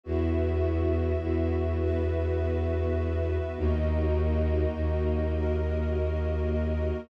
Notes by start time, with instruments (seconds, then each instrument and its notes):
0.03 violin E2, pad 2 (warm) B3 E4 F#4, string ensemble 1 F#4 B4 E5
1.22 violin E2
1.80 pad 2 (warm) B3 F#4 B4
3.57 violin D#2, pad 2 (warm) A#3 D#4 F#4, string ensemble 1 F#4 A#4 D#5
4.75 violin D#2
5.34 pad 2 (warm) A#3 F#4 A#4